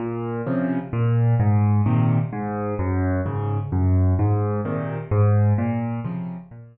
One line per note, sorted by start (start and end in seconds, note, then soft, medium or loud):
0.00 0.42 A#2 loud
0.47 0.79 C3 medium
0.47 0.79 C#3 medium
0.47 0.79 F3 medium
0.93 1.35 A#2 loud
1.40 1.81 G#2 loud
1.86 2.18 A#2 medium
1.86 2.18 C3 medium
1.86 2.18 D#3 medium
2.33 2.74 G#2 loud
2.79 3.21 F#2 loud
3.26 3.58 G#2 medium
3.26 3.58 C#3 medium
3.72 4.14 F#2 loud
4.19 4.61 G#2 loud
4.65 4.98 A#2 medium
4.65 4.98 C3 medium
4.65 4.98 D#3 medium
5.11 5.53 G#2 loud
5.58 6.00 A#2 loud
6.04 6.37 C3 medium
6.04 6.37 C#3 medium
6.04 6.37 F3 medium
6.51 6.77 A#2 loud